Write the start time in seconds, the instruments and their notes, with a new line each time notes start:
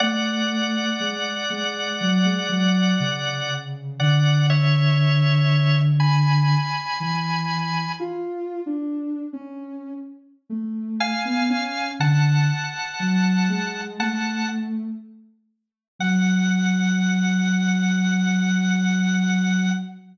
0.00 ocarina A3, drawbar organ D5 F#5
1.00 ocarina G#3
1.50 ocarina G#3
2.01 ocarina F#3
2.25 ocarina G#3
2.49 ocarina F#3
3.00 ocarina C#3
4.00 ocarina D3, drawbar organ D5 F#5
4.50 drawbar organ C#5 E5
6.00 drawbar organ G#5 B5
7.00 ocarina E3
8.00 ocarina F4
8.66 ocarina D4
9.33 ocarina C#4
10.50 ocarina A3
11.00 drawbar organ F5 G#5
11.25 ocarina B3
11.49 ocarina C#4
12.00 ocarina D3, drawbar organ F#5 A5
13.00 ocarina F#3
13.49 ocarina G#3
13.99 ocarina A3, drawbar organ F#5 A5
15.99 ocarina F#3, drawbar organ F#5